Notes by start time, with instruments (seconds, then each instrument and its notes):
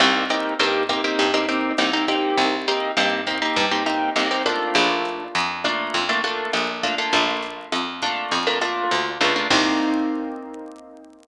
0.00 electric bass (finger) C2, acoustic guitar (steel) A#3 C4 D#4 G4, kick, cross-stick, closed hi-hat
0.30 acoustic guitar (steel) A#3 C4 D#4 G4, closed hi-hat
0.59 electric bass (finger) G2, acoustic guitar (steel) A#3 C4 D#4 G4, closed hi-hat
0.89 acoustic guitar (steel) A#3 C4 D#4 G4, kick, cross-stick, closed hi-hat
1.04 acoustic guitar (steel) A#3 C4 D#4 G4
1.18 electric bass (finger) G2, kick, closed hi-hat
1.34 acoustic guitar (steel) A#3 C4 D#4 G4
1.49 acoustic guitar (steel) A#3 C4 D#4 G4, closed hi-hat
1.78 electric bass (finger) C2, acoustic guitar (steel) A#3 C4 D#4 G4, cross-stick, closed hi-hat
1.93 acoustic guitar (steel) A#3 C4 D#4 G4
2.08 acoustic guitar (steel) A#3 C4 D#4 G4, kick, closed hi-hat
2.37 electric bass (finger) C2, kick, closed hi-hat
2.67 acoustic guitar (steel) A#3 C4 D#4 G4, closed hi-hat
2.97 electric bass (finger) G2, acoustic guitar (steel) A#3 C4 D#4 G4, cross-stick, closed hi-hat
3.27 acoustic guitar (steel) A#3 C4 D#4 G4, kick, closed hi-hat
3.42 acoustic guitar (steel) A#3 C4 D#4 G4
3.56 electric bass (finger) G2, kick, closed hi-hat
3.71 acoustic guitar (steel) A#3 C4 D#4 G4
3.86 acoustic guitar (steel) A#3 C4 D#4 G4, cross-stick, closed hi-hat
4.16 electric bass (finger) C2, acoustic guitar (steel) A#3 C4 D#4 G4, closed hi-hat
4.31 acoustic guitar (steel) A#3 C4 D#4 G4
4.46 acoustic guitar (steel) A3 A#3 D4 F4, kick, closed hi-hat
4.75 electric bass (finger) A#1, kick, cross-stick, closed hi-hat
5.05 closed hi-hat
5.35 electric bass (finger) F2, closed hi-hat
5.64 acoustic guitar (steel) A3 A#3 D4 F4, kick, cross-stick, closed hi-hat
5.94 electric bass (finger) F2, kick, closed hi-hat
6.09 acoustic guitar (steel) A3 A#3 D4 F4
6.24 acoustic guitar (steel) A3 A#3 D4 F4, closed hi-hat
6.53 electric bass (finger) A#1, cross-stick, closed hi-hat
6.83 acoustic guitar (steel) A3 A#3 D4 F4, kick, closed hi-hat
6.98 acoustic guitar (steel) A3 A#3 D4 F4
7.13 electric bass (finger) A#1, kick, closed hi-hat
7.43 closed hi-hat
7.72 electric bass (finger) F2, cross-stick, closed hi-hat
8.02 acoustic guitar (steel) A3 A#3 D4 F4, kick, closed hi-hat
8.31 electric bass (finger) F2, kick, closed hi-hat
8.47 acoustic guitar (steel) A3 A#3 D4 F4
8.61 acoustic guitar (steel) A3 A#3 D4 F4, cross-stick, closed hi-hat
8.91 electric bass (finger) D2, closed hi-hat
9.21 electric bass (finger) C#2, acoustic guitar (steel) A3 A#3 D4 F4, kick, closed hi-hat
9.36 acoustic guitar (steel) A3 A#3 D4 F4
9.50 electric bass (finger) C2, acoustic guitar (steel) A#3 C4 D#4 G4, kick, crash